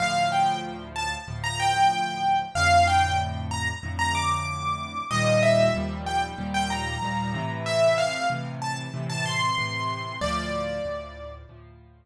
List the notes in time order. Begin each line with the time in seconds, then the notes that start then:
0.00 D2 A2 F3 F5
0.32 G5
0.96 A5
1.28 D2 A2 F3
1.44 A#5
1.60 G5
2.55 F2 A2 D3 F5
2.87 G5
3.51 A#5
3.83 F2 A2 D3
3.99 A#5
4.15 D6
5.11 D#2 A#2 F3 G3 D#5
5.43 E5
5.74 D#2 A#2 F3 G3
6.06 G5
6.38 D#2 A#2 F3 G3
6.54 G5
6.70 A#5
7.02 D#2 A#2 F3 G3
7.34 A2 C3 E3
7.66 E5
7.98 F5
8.30 A2 C3 E3
8.62 A5
8.94 A2 C3 E3
9.10 A5
9.26 C6
9.58 A2 C3 E3
10.21 D2 A2 F3 D5
10.85 D2 A2 F3
11.49 D2 A2 F3